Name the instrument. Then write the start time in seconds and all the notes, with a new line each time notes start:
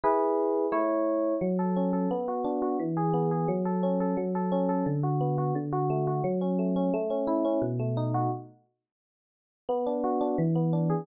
electric piano 1
0.04 E4 G#4 B4
0.72 A3 E4 C#5
1.41 F#3
1.59 A4
1.76 C#4
1.93 A4
2.11 B3
2.28 F#4
2.44 D4
2.62 F#4
2.79 E3
2.97 G#4
3.14 B3
3.31 G#4
3.48 F#3
3.65 A4
3.83 C#4
4.00 A4
4.17 F#3
4.35 A4
4.52 C#4
4.69 A4
4.86 D3
5.03 F#4
5.21 B3
5.38 F#4
5.55 D3
5.73 F#4
5.90 A3
6.07 F#4
6.24 F#3
6.41 C#4
6.59 A3
6.76 C#4
6.94 A3
7.10 C#4
7.27 E4
7.45 C#4
7.62 B2
7.79 A3
7.97 D#4
8.14 F#4
9.69 B3
9.86 D4
10.04 F#4
10.21 D4
10.38 E3
10.55 B3
10.73 D4
10.90 G#4